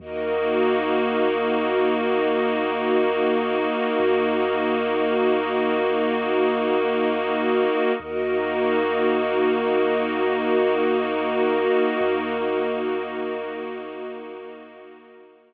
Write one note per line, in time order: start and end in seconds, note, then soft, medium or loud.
0.00 3.68 D#2 medium
0.00 7.92 A#3 medium
0.00 7.92 D#4 medium
0.00 7.91 F#4 medium
0.00 7.92 F#4 medium
0.00 7.91 A#4 medium
0.00 7.91 D#5 medium
4.00 7.68 D#2 medium
7.99 11.68 D#2 medium
7.99 15.54 A#3 medium
7.99 15.54 D#4 medium
7.99 15.54 F#4 loud
7.99 15.54 F#4 medium
7.99 15.54 A#4 medium
7.99 15.54 D#5 medium
12.01 15.54 D#2 medium